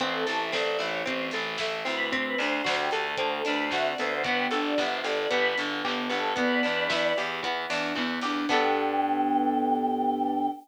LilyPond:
<<
  \new Staff \with { instrumentName = "Choir Aahs" } { \time 4/4 \key g \major \tempo 4 = 113 c''16 a'8 e''16 d''16 d''16 des''8 c''8 r4 b'8 | c''16 b'16 c''8. g'8 a'8 a'16 b'16 c''16 e''16 d''16 c''8 | b'16 g'8 d''16 e''16 c''16 d''8 b'8 r4 a'8 | <b' d''>4. r2 r8 |
g''1 | }
  \new Staff \with { instrumentName = "Acoustic Grand Piano" } { \time 4/4 \key g \major c'8 e'8 a'8 e'8 c'8 e'8 a'8 e'8 | c'8 d'8 fis'8 a'8 fis'8 d'8 c'8 b8~ | b8 d'8 g'8 a'8 g'8 d'8 b8 d'8 | b8 d'8 e'8 g'8 e'8 d'8 b8 d'8 |
<b d' g' a'>1 | }
  \new Staff \with { instrumentName = "Pizzicato Strings" } { \time 4/4 \key g \major c'8 a'8 c'8 e'8 c'8 a'8 e'8 c'8 | c'8 d'8 fis'8 a'8 c'8 d'8 fis'8 a'8 | b8 a'8 b8 g'8 b8 a'8 g'8 b8 | b8 d'8 e'8 g'8 b8 d'8 e'8 g'8 |
<b d' g' a'>1 | }
  \new Staff \with { instrumentName = "Electric Bass (finger)" } { \clef bass \time 4/4 \key g \major a,,8 a,,8 a,,8 a,,8 a,,8 a,,8 a,,8 d,8~ | d,8 d,8 d,8 d,8 d,8 d,8 d,8 d,8 | g,,8 g,,8 g,,8 g,,8 g,,8 g,,8 g,,8 g,,8 | e,8 e,8 e,8 e,8 e,8 e,8 e,8 e,8 |
g,1 | }
  \new DrumStaff \with { instrumentName = "Drums" } \drummode { \time 4/4 <hh bd>8 hho8 <bd sn>8 hho8 <hh bd>8 hho8 <bd sn>8 hho8 | <hh bd>8 hho8 <bd sn>8 hho8 <hh bd>8 hho8 <bd sn>8 hho8 | <hh bd>8 hho8 <bd sn>8 hho8 <hh bd>8 hho8 <hc bd>8 hho8 | <hh bd>8 hho8 <bd sn>8 hho8 <hh bd>8 hho8 <hc bd>8 hho8 |
<cymc bd>4 r4 r4 r4 | }
>>